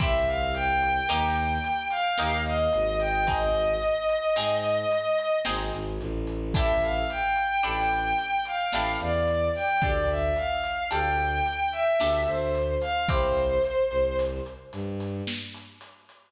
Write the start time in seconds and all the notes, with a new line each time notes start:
0.00 C2 C4 E4 G4 E5, kick, closed hi-hat
0.27 F5, closed hi-hat
0.55 G5, closed hi-hat
0.82 closed hi-hat
1.09 D#2 A#3 D#4 G4 G5, closed hi-hat
1.36 closed hi-hat
1.64 closed hi-hat
1.90 F5, closed hi-hat
2.18 D#2 A#3 D#4 G4, snare
2.45 D#5, closed hi-hat
2.73 G#1, closed hi-hat
3.00 G5, closed hi-hat
3.27 C4 D#4 G#4 D#5, kick, closed hi-hat
3.55 closed hi-hat
3.81 closed hi-hat
4.09 closed hi-hat
4.36 G#2 C4 D#4 G#4, closed hi-hat
4.64 closed hi-hat
4.91 closed hi-hat
5.18 closed hi-hat
5.45 G#1 C4 D#4 G#4, snare
5.72 G#1, closed hi-hat
6.00 A1, closed hi-hat
6.27 closed hi-hat
6.54 D4 E4 G4 A4 E5, kick, closed hi-hat
6.81 F5, closed hi-hat
7.10 G5, closed hi-hat
7.36 closed hi-hat
7.63 A1 D4 E4 G4 A4 G5, closed hi-hat
7.91 closed hi-hat
8.19 closed hi-hat
8.45 F5, closed hi-hat
8.72 A1 D4 E4 G4 A4, snare
9.00 E2 D5, closed hi-hat
9.28 closed hi-hat
9.55 G5, open hi-hat
9.82 D2 D4 G4 A4 D5, kick, closed hi-hat
10.08 E5, closed hi-hat
10.36 F5, closed hi-hat
10.64 closed hi-hat
10.90 D2 D4 G4 A4 G5, closed hi-hat
11.19 closed hi-hat
11.46 closed hi-hat
11.72 E5, closed hi-hat
12.00 D2 D4 G4 A4, snare
12.27 D2 C5, closed hi-hat
12.55 closed hi-hat
12.81 F5, closed hi-hat
13.08 C2 C4 E4 G4 C5, kick, closed hi-hat
13.37 closed hi-hat
13.64 closed hi-hat
13.91 C2, closed hi-hat
14.19 closed hi-hat
14.46 closed hi-hat
14.73 G2, closed hi-hat
15.00 closed hi-hat
15.27 snare
15.54 closed hi-hat
15.81 closed hi-hat
16.09 closed hi-hat